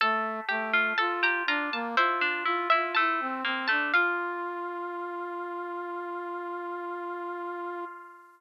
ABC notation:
X:1
M:4/4
L:1/16
Q:1/4=61
K:F
V:1 name="Harpsichord"
a2 g2 a b b a c3 e a3 a | f16 |]
V:2 name="Pizzicato Strings"
A2 G F A G F2 E D E E A,2 B, A, | F16 |]
V:3 name="Brass Section"
A,2 A,2 F2 D B, F2 F F E C C D | F16 |]